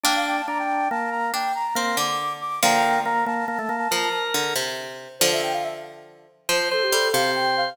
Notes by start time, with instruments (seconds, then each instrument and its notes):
0.04 pizzicato strings A#3 D4, drawbar organ D4, flute G5
0.15 flute F5
0.27 flute G5
0.36 flute A5
0.48 drawbar organ D4, flute A#5
0.59 flute G5
0.90 drawbar organ A#3, flute A5
1.11 flute A#5
1.34 pizzicato strings D4, flute G5
1.55 flute A#5
1.75 drawbar organ A#3, pizzicato strings C4, flute C6
1.97 pizzicato strings D3, flute D6
2.41 flute D6
2.63 pizzicato strings D3 F3, drawbar organ A#3, flute G5 A#5
3.05 drawbar organ A#3, flute A#5
3.26 drawbar organ A#3, flute A5
3.48 drawbar organ A#3
3.59 drawbar organ A3
3.69 drawbar organ A#3
3.91 pizzicato strings F3, drawbar organ A#4
4.34 pizzicato strings D3
4.56 pizzicato strings C3
5.20 pizzicato strings D3 F3, flute C5
5.32 flute E5
5.42 flute G5
5.53 flute F5
5.63 flute E5
6.49 pizzicato strings F3, drawbar organ C5, flute C5
6.71 flute A4, drawbar organ C5
6.82 flute G4
6.92 pizzicato strings G3, flute A4
7.13 pizzicato strings C3, drawbar organ C5, flute F5
7.36 flute G5
7.57 flute F5